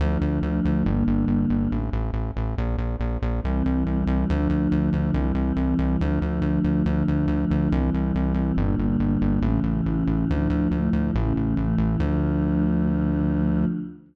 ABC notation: X:1
M:2/2
L:1/8
Q:1/2=70
K:Dm
V:1 name="Choir Aahs"
[D,F,A,]4 [D,G,B,]4 | z8 | [C,E,G,]4 [D,F,A,]4 | [C,E,G,]4 [D,F,A,]4 |
[D,F,A,]4 [C,E,G,]4 | [B,,D,G,]4 [A,,^C,E,]4 | [A,,D,F,]2 [A,,F,A,]2 [A,,^C,E,]2 [A,,E,A,]2 | [D,F,A,]8 |]
V:2 name="Synth Bass 1" clef=bass
D,, D,, D,, D,, G,,, G,,, G,,, G,,, | A,,, A,,, A,,, A,,, B,,, B,,, B,,, B,,, | C,, C,, C,, C,, D,, D,, D,, D,, | C,, C,, C,, C,, D,, D,, D,, D,, |
D,, D,, D,, D,, C,, C,, C,, C,, | G,,, G,,, G,,, G,,, A,,, A,,, A,,, A,,, | D,, D,, D,, D,, A,,, A,,, A,,, A,,, | D,,8 |]